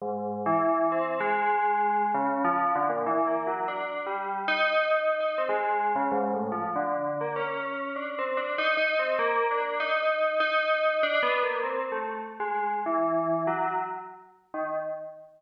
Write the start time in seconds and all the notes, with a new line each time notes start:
0.02 G#2
0.46 E3
0.92 C4
1.20 G#3
2.14 C#3
2.45 F3
2.75 D3
2.89 A#2
3.06 E3
3.27 A#3
3.47 F#3
3.68 D4
4.06 G3
4.48 D#4
4.91 D#4
5.20 D#4
5.38 C4
5.49 G#3
5.96 C#3
6.12 G#2
6.34 A2
6.52 F3
6.76 D3
7.21 A#3
7.36 C#4
7.96 D4
8.19 C4
8.37 D4
8.58 D#4
8.77 D#4
8.99 C4
9.19 A#3
9.51 D4
9.80 D#4
10.40 D#4
11.03 D4
11.23 B3
11.43 A#3
11.63 C4
11.92 A3
12.40 G#3
12.86 E3
13.47 F#3
14.54 D#3